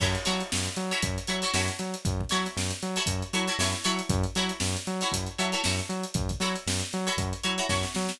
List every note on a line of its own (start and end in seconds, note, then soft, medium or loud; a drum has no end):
0.00 0.16 F#2 medium
0.00 0.21 E4 medium
0.00 0.21 F#4 medium
0.00 0.21 A4 medium
0.00 0.21 C#5 medium
0.00 kick loud
0.00 crash loud
0.15 snare soft
0.15 closed hi-hat medium
0.25 0.43 F#3 medium
0.25 0.68 E4 medium
0.25 0.68 F#4 medium
0.25 0.68 A4 medium
0.25 0.68 C#5 medium
0.25 snare medium
0.25 closed hi-hat medium
0.40 closed hi-hat medium
0.52 0.68 F#2 medium
0.52 snare loud
0.66 closed hi-hat medium
0.76 0.92 F#3 medium
0.76 closed hi-hat medium
0.91 1.21 E4 medium
0.91 1.21 F#4 medium
0.91 1.21 A4 medium
0.91 1.21 C#5 medium
0.91 snare soft
0.91 closed hi-hat medium
1.02 1.18 F#2 medium
1.02 kick loud
1.02 closed hi-hat loud
1.18 closed hi-hat medium
1.27 1.44 F#3 medium
1.27 1.40 E4 medium
1.27 1.40 F#4 medium
1.27 1.40 A4 medium
1.27 1.40 C#5 medium
1.27 closed hi-hat medium
1.42 1.52 E4 medium
1.42 1.52 F#4 medium
1.42 1.52 A4 medium
1.42 1.52 C#5 medium
1.42 closed hi-hat medium
1.54 1.70 F#2 medium
1.54 1.96 E4 medium
1.54 1.96 F#4 medium
1.54 1.96 A4 medium
1.54 1.96 C#5 medium
1.54 snare loud
1.68 closed hi-hat medium
1.79 1.95 F#3 medium
1.79 snare soft
1.79 closed hi-hat medium
1.94 closed hi-hat medium
2.05 2.22 F#2 medium
2.05 kick loud
2.05 closed hi-hat loud
2.21 kick medium
2.29 2.47 F#3 medium
2.29 2.73 E4 medium
2.29 2.73 F#4 medium
2.29 2.73 A4 medium
2.29 2.73 C#5 medium
2.29 snare medium
2.29 closed hi-hat medium
2.45 snare soft
2.45 closed hi-hat medium
2.57 2.72 F#2 medium
2.57 snare loud
2.71 closed hi-hat medium
2.82 2.98 F#3 medium
2.82 closed hi-hat medium
2.96 3.27 E4 medium
2.96 3.27 F#4 medium
2.96 3.27 A4 medium
2.96 3.27 C#5 medium
2.96 closed hi-hat medium
3.06 3.23 F#2 medium
3.06 kick medium
3.06 closed hi-hat loud
3.22 closed hi-hat medium
3.33 3.49 F#3 medium
3.33 3.45 E4 medium
3.33 3.45 F#4 medium
3.33 3.45 A4 medium
3.33 3.45 C#5 medium
3.33 snare soft
3.33 closed hi-hat medium
3.47 3.57 E4 medium
3.47 3.57 F#4 medium
3.47 3.57 A4 medium
3.47 3.57 C#5 medium
3.47 closed hi-hat medium
3.59 3.74 F#2 medium
3.59 3.84 E4 medium
3.59 3.84 F#4 medium
3.59 3.84 A4 medium
3.59 3.84 C#5 medium
3.59 snare loud
3.72 snare medium
3.72 closed hi-hat medium
3.84 4.01 F#3 medium
3.84 4.31 E4 medium
3.84 4.31 F#4 medium
3.84 4.31 A4 medium
3.84 4.31 C#5 medium
3.84 closed hi-hat medium
3.99 closed hi-hat medium
4.09 4.25 F#2 loud
4.09 kick loud
4.09 closed hi-hat loud
4.23 closed hi-hat medium
4.35 4.51 F#3 medium
4.35 4.78 E4 medium
4.35 4.78 F#4 medium
4.35 4.78 A4 medium
4.35 4.78 C#5 medium
4.35 snare medium
4.35 closed hi-hat medium
4.49 closed hi-hat medium
4.60 4.76 F#2 medium
4.60 snare loud
4.76 closed hi-hat medium
4.87 5.03 F#3 medium
4.87 closed hi-hat medium
5.01 5.32 E4 medium
5.01 5.32 F#4 medium
5.01 5.32 A4 medium
5.01 5.32 C#5 medium
5.01 snare soft
5.01 closed hi-hat medium
5.12 5.28 F#2 medium
5.12 kick medium
5.12 closed hi-hat loud
5.26 closed hi-hat medium
5.38 5.54 F#3 medium
5.38 5.50 E4 medium
5.38 5.50 F#4 medium
5.38 5.50 A4 medium
5.38 5.50 C#5 medium
5.38 closed hi-hat medium
5.52 5.62 E4 medium
5.52 5.62 F#4 medium
5.52 5.62 A4 medium
5.52 5.62 C#5 medium
5.52 closed hi-hat medium
5.64 5.81 F#2 medium
5.64 6.06 E4 medium
5.64 6.06 F#4 medium
5.64 6.06 A4 medium
5.64 6.06 C#5 medium
5.64 snare loud
5.79 closed hi-hat medium
5.89 6.05 F#3 medium
5.89 closed hi-hat medium
6.03 closed hi-hat medium
6.14 6.31 F#2 medium
6.14 kick loud
6.14 closed hi-hat loud
6.29 kick medium
6.29 closed hi-hat medium
6.40 6.56 F#3 medium
6.40 6.83 E4 medium
6.40 6.83 F#4 medium
6.40 6.83 A4 medium
6.40 6.83 C#5 medium
6.40 snare medium
6.40 closed hi-hat medium
6.56 closed hi-hat medium
6.67 6.82 F#2 medium
6.67 snare loud
6.80 closed hi-hat medium
6.92 7.09 F#3 medium
6.92 snare soft
6.92 closed hi-hat medium
7.07 7.37 E4 medium
7.07 7.37 F#4 medium
7.07 7.37 A4 medium
7.07 7.37 C#5 medium
7.07 closed hi-hat medium
7.17 7.33 F#2 medium
7.17 kick loud
7.17 closed hi-hat loud
7.33 closed hi-hat medium
7.43 7.60 F#3 medium
7.43 7.55 E4 medium
7.43 7.55 F#4 medium
7.43 7.55 A4 medium
7.43 7.55 C#5 medium
7.43 closed hi-hat medium
7.58 7.67 E4 medium
7.58 7.67 F#4 medium
7.58 7.67 A4 medium
7.58 7.67 C#5 medium
7.58 closed hi-hat medium
7.69 7.85 F#2 medium
7.69 8.12 E4 medium
7.69 8.12 F#4 medium
7.69 8.12 A4 medium
7.69 8.12 C#5 medium
7.69 kick medium
7.69 snare medium
7.83 snare medium
7.95 8.11 F#3 medium
7.95 snare medium
8.09 snare loud